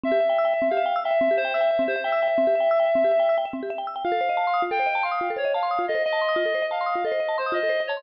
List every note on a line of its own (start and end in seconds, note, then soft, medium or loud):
0.03 0.11 C4 medium
0.03 0.67 E5 medium
0.12 0.19 G4 medium
0.20 0.28 E5 medium
0.29 0.37 G5 medium
0.38 0.46 E6 medium
0.45 0.52 G5 medium
0.54 0.61 E5 medium
0.62 0.69 C4 medium
0.70 0.79 G4 medium
0.70 0.99 F5 medium
0.77 0.85 E5 medium
0.86 0.93 G5 medium
0.96 1.03 E6 medium
1.04 1.35 E5 medium
1.04 1.13 G5 medium
1.11 1.18 E5 medium
1.21 1.28 C4 medium
1.31 1.38 G4 medium
1.37 1.53 C5 loud
1.37 1.46 E5 medium
1.45 1.52 G5 medium
1.54 1.83 E5 medium
1.54 1.62 E6 medium
1.61 1.68 G5 medium
1.71 1.78 E5 medium
1.79 1.87 C4 medium
1.88 1.95 G4 medium
1.88 2.02 C5 medium
1.96 2.03 E5 medium
2.04 3.35 E5 loud
2.04 2.12 G5 medium
2.12 2.20 E6 medium
2.23 2.30 G5 medium
2.28 2.35 E5 medium
2.38 2.45 C4 medium
2.47 2.55 G4 medium
2.55 2.63 E5 medium
2.60 2.68 G5 medium
2.71 2.78 E6 medium
2.80 2.87 G5 medium
2.85 2.93 E5 medium
2.95 3.03 C4 medium
3.04 3.12 G4 medium
3.12 3.19 E5 medium
3.20 3.27 G5 medium
3.29 3.37 E6 medium
3.38 3.45 G5 medium
3.45 3.53 E5 medium
3.53 3.61 C4 medium
3.63 3.70 G4 medium
3.70 3.78 E5 medium
3.78 3.86 G5 medium
3.87 3.95 E6 medium
3.96 4.03 G5 medium
4.04 4.12 F4 medium
4.04 4.62 F5 loud
4.12 4.19 A4 medium
4.21 4.28 C5 medium
4.29 4.37 D#5 medium
4.37 4.45 A5 medium
4.47 4.55 C6 medium
4.54 4.61 D#6 medium
4.62 4.70 F4 medium
4.71 4.79 A4 medium
4.71 5.03 G5 medium
4.80 4.87 C5 medium
4.86 4.94 D#5 medium
4.95 5.03 A5 medium
5.03 5.31 F5 medium
5.03 5.11 C6 medium
5.11 5.19 D#6 medium
5.21 5.28 F4 medium
5.30 5.38 A4 medium
5.36 5.44 C5 medium
5.36 5.52 C#5 medium
5.45 5.52 D#5 medium
5.54 5.85 F5 medium
5.54 5.62 A5 medium
5.63 5.70 C6 medium
5.71 5.78 D#6 medium
5.79 5.86 F4 medium
5.88 5.97 A4 medium
5.88 6.02 D#5 medium
5.95 6.02 C5 medium
6.04 6.65 D#5 loud
6.04 6.13 D#5 medium
6.13 6.20 A5 medium
6.22 6.29 C6 medium
6.29 6.36 D#6 medium
6.36 6.44 F4 medium
6.45 6.53 A4 medium
6.55 6.62 C5 medium
6.62 6.70 D#5 medium
6.71 7.04 F5 medium
6.71 6.79 A5 medium
6.81 6.88 C6 medium
6.86 6.94 D#6 medium
6.95 7.03 F4 medium
7.05 7.12 A4 medium
7.05 7.37 D#5 medium
7.12 7.19 C5 medium
7.20 7.28 D#5 medium
7.29 7.36 A5 medium
7.38 7.53 C5 medium
7.38 7.45 C6 medium
7.46 7.54 D#6 medium
7.52 7.60 F4 medium
7.52 7.81 D#5 medium
7.63 7.71 A4 medium
7.69 7.77 C5 medium
7.80 7.88 D#5 medium
7.87 8.03 C#5 medium
7.87 7.97 A5 medium
7.97 8.03 C6 medium